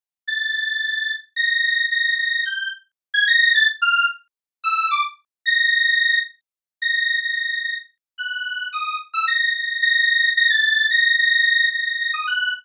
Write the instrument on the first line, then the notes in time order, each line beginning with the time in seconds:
lead 2 (sawtooth)
0.28 A6
1.36 A#6
1.91 A#6
2.18 A#6
2.45 G6
3.14 G#6
3.28 A#6
3.55 A6
3.82 F6
4.64 E6
4.91 D6
5.46 A#6
6.82 A#6
7.23 A#6
7.36 A#6
7.64 A#6
8.18 F#6
8.73 D#6
9.14 E6
9.27 A#6
9.54 A#6
9.82 A#6
10.36 A#6
10.50 A6
10.91 A#6
11.18 A#6
11.73 A#6
11.86 A#6
12.00 A#6
12.14 D#6
12.27 F#6